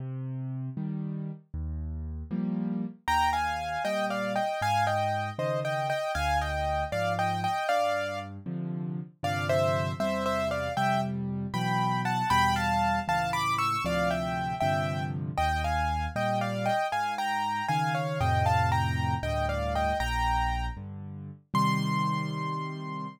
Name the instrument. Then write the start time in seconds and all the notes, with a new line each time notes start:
acoustic grand piano
0.00 C3
0.77 D#3 G3
1.54 D#2
2.31 F3 G3 A#3
3.08 D#2 G5 A#5
3.33 F5 G#5
3.85 A#2 G3 D#5 G5
4.10 D5 F5
4.36 D#5 G5
4.62 G#2 F5 G#5
4.87 D#5 G5
5.39 C#3 D#3 C5 D#5
5.65 D#5 G5
5.90 D#5 G5
6.15 D2 F5 G#5
6.41 D#5 G5
6.92 G#2 F3 D5 F5
7.19 D#5 G5
7.44 D#5 G5
7.69 G2 D5 F5
8.46 C3 D3 F3
9.23 G2 C3 D3 F3 D5 F5
9.49 C5 E5
10.00 E2 C3 G3 C5 E5
10.26 C5 E5
10.51 D5 F5
10.77 F2 C3 G3 E5 G5
11.54 B2 E3 F#3 G5 B5
12.05 F#5 A5
12.30 E2 B2 G3 G5 B5
12.56 F5 A5
13.08 C#2 A2 E3 F5 A5
13.33 B5 D6
13.58 C#6 E6
13.85 D2 A2 C3 F3 D5 F5
14.11 E5 G5
14.60 G2 C3 D3 F3 E5 G5
15.38 D#2 D#5 G5
15.64 F5 G#5
16.16 A#2 G3 D#5 G5
16.41 D5 F5
16.66 D#5 G5
16.92 G#2 F5 G#5
17.18 G5 A#5
17.68 C#3 D#3 F5 G#5
17.95 C#5 F5
18.21 F2 A2 C3 D#5 G5
18.46 F5 A5
18.72 G5 A#5
19.23 D2 G2 A2 D#5 G5
19.49 D5 F5
19.75 D#5 G5
20.00 A#1 G5 A#5
20.77 G2 D3
21.54 C3 D#3 G3 C6